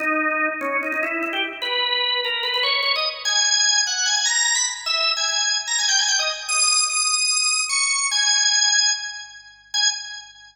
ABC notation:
X:1
M:4/4
L:1/16
Q:1/4=148
K:G#m
V:1 name="Drawbar Organ"
D6 C2 D D E2 E =G z2 | B6 A2 B B c2 c d z2 | g6 f2 g g a2 a b z2 | e3 g g3 z a g =g ^g =g d z2 |
d'4 d'8 c'4 | g8 z8 | g4 z12 |]